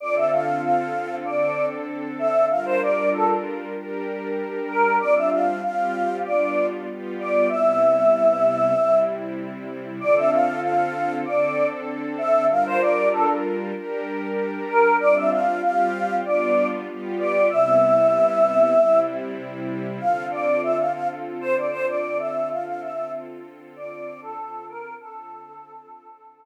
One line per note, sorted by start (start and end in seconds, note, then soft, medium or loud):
0.00 1.23 D3 medium
0.00 1.23 C4 medium
0.00 1.25 F4 medium
0.00 1.23 A4 medium
0.00 0.15 D5 medium
0.15 0.30 E5 medium
0.32 0.61 F5 medium
0.62 1.15 F5 medium
1.24 2.48 D3 medium
1.24 2.48 C4 medium
1.24 2.48 D4 medium
1.24 2.48 A4 medium
1.24 1.66 D5 medium
2.19 2.45 E5 medium
2.50 3.74 G3 medium
2.50 3.74 D4 medium
2.50 3.74 F4 medium
2.50 3.74 A#4 medium
2.50 2.65 F5 medium
2.65 2.80 C5 medium
2.81 3.09 D5 medium
3.13 3.28 A4 medium
3.74 4.98 G3 medium
3.74 4.98 D4 medium
3.74 4.98 G4 medium
3.74 4.98 A#4 medium
4.68 4.96 A#4 medium
5.00 5.62 G3 medium
5.00 5.62 C4 medium
5.00 5.62 D4 medium
5.00 5.62 F4 medium
5.00 5.15 D5 medium
5.15 5.30 E5 medium
5.32 5.62 F5 medium
5.63 6.24 G3 medium
5.63 6.25 C4 medium
5.63 6.24 F4 medium
5.63 6.25 G4 medium
5.63 6.17 F5 medium
6.24 6.86 G3 medium
6.24 6.86 B3 medium
6.24 6.87 D4 medium
6.24 6.86 F4 medium
6.24 6.66 D5 medium
6.87 7.49 G3 medium
6.87 7.49 B3 medium
6.87 7.49 F4 medium
6.87 7.49 G4 medium
7.20 7.48 D5 medium
7.49 8.73 C3 medium
7.49 8.73 G3 medium
7.49 8.73 B3 medium
7.49 8.73 E4 medium
7.49 8.99 E5 medium
8.76 10.00 C3 medium
8.76 10.00 G3 medium
8.76 10.00 C4 medium
8.76 10.00 E4 medium
10.00 11.24 D3 medium
10.00 11.24 C4 medium
10.00 11.24 F4 medium
10.00 11.24 A4 medium
10.00 10.15 D5 medium
10.16 10.31 E5 medium
10.31 10.60 F5 medium
10.62 11.15 F5 medium
11.25 12.49 D3 medium
11.25 12.49 C4 medium
11.25 12.48 D4 medium
11.25 12.49 A4 medium
11.25 11.66 D5 medium
12.18 12.45 E5 medium
12.49 13.73 G3 medium
12.49 13.73 D4 medium
12.49 13.73 F4 medium
12.49 13.73 A#4 medium
12.49 12.65 F5 medium
12.66 12.81 C5 medium
12.81 13.09 D5 medium
13.13 13.28 A4 medium
13.74 14.98 G3 medium
13.74 14.98 D4 medium
13.74 14.98 G4 medium
13.74 14.98 A#4 medium
14.69 14.96 A#4 medium
15.00 15.61 G3 medium
15.00 15.61 C4 medium
15.00 15.62 D4 medium
15.00 15.61 F4 medium
15.00 15.15 D5 loud
15.15 15.30 E5 medium
15.31 15.61 F5 medium
15.61 16.23 G3 medium
15.61 16.23 C4 medium
15.61 16.23 F4 medium
15.61 16.23 G4 medium
15.61 16.16 F5 medium
16.24 16.86 G3 medium
16.24 16.86 B3 medium
16.24 16.86 D4 medium
16.24 16.86 F4 medium
16.24 16.67 D5 medium
16.88 17.49 G3 medium
16.88 17.49 B3 medium
16.88 17.49 F4 medium
16.88 17.49 G4 medium
17.19 17.48 D5 medium
17.50 18.74 C3 medium
17.50 18.74 G3 medium
17.50 18.74 B3 medium
17.50 18.74 E4 medium
17.50 19.00 E5 loud
18.76 19.99 C3 medium
18.76 19.99 G3 medium
18.76 19.99 C4 medium
18.76 19.99 E4 medium
19.99 24.95 D3 medium
19.99 24.95 C4 medium
19.99 24.95 F4 medium
19.99 24.95 A4 medium
19.99 20.25 F5 medium
20.31 20.61 D5 medium
20.62 20.77 E5 medium
20.78 20.92 F5 medium
20.93 21.08 F5 medium
21.41 21.56 C5 medium
21.56 21.71 D5 medium
21.71 21.86 C5 medium
21.88 22.18 D5 medium
22.18 22.49 E5 medium
22.50 22.65 F5 medium
22.66 22.81 F5 medium
22.81 23.11 E5 medium
23.76 24.20 D5 medium
24.22 24.65 A4 medium
24.69 24.94 A#4 medium
25.00 26.45 D3 medium
25.00 26.45 C4 medium
25.00 26.45 F4 medium
25.00 26.45 A4 medium